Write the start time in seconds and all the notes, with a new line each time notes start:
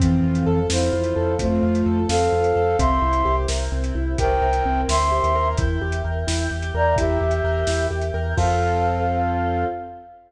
0.00 F2 E3 C4 F4 A4, kick, closed hi-hat
0.23 F2 F4
0.35 closed hi-hat
0.46 F2 A4
0.69 F2 C4 E4 C5, snare
0.93 F2 F4
1.04 closed hi-hat
1.16 F2 A4
1.39 F2 A3 C4 F4 A4 C5, kick, closed hi-hat
1.63 F2 F4
1.75 closed hi-hat
1.86 F2 A4
2.09 F2 C4 A4 F5, snare
2.32 F2 F4
2.44 closed hi-hat
2.55 F2 A4
2.79 C2 C4 E4 G4 A#4 E5 C6, kick, closed hi-hat
3.02 C2 E4
3.13 closed hi-hat
3.25 C2 G4
3.48 C2 A#4, snare
3.72 C2 C4
3.84 closed hi-hat
3.95 C2 E4
4.18 C2 C4 E4 G4 A#4 C5 G5, kick, closed hi-hat
4.42 C2 A#4
4.53 closed hi-hat
4.65 C2 C4
4.88 D2 E4 E5 C6, snare
5.12 G4
5.23 D#2, closed hi-hat
5.35 A#4
5.57 E2 E4 A#4 E5 G5, kick, closed hi-hat
5.81 E2 G4
5.92 closed hi-hat
6.04 E2 A#4
6.27 E2 E4, snare
6.51 E2 G4
6.62 closed hi-hat
6.74 E2 A#4 D5 A#5
6.96 E2 E4 G4 E5, kick, closed hi-hat
7.20 E2 G4
7.31 closed hi-hat
7.44 E2 A#4
7.67 E2 E4, snare
7.91 E2 G4
8.01 closed hi-hat
8.14 E2 A#4
8.37 F2 C4 F4 A4 F5, kick, crash